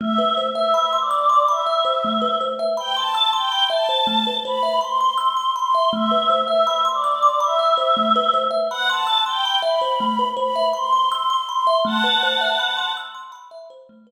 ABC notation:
X:1
M:4/4
L:1/16
Q:1/4=81
K:Ador
V:1 name="Choir Aahs"
(3e4 e4 d4 e6 z g | a2 g2 a4 b2 c'4 c'2 | (3e4 e4 d4 e6 z f | a2 g2 b4 b2 c'4 c'2 |
[fa]6 z10 |]
V:2 name="Kalimba"
A, B c e b c' e' c' b e c A, B c e b | c' e' c' b e c A, B c e b c' e' c' b e | A, B c e b c' e' c' b e c A, B c e b | c' e' c' b e c A, B c e b c' e' c' b e |
A, B c e b c' e' c' b e c A, B z3 |]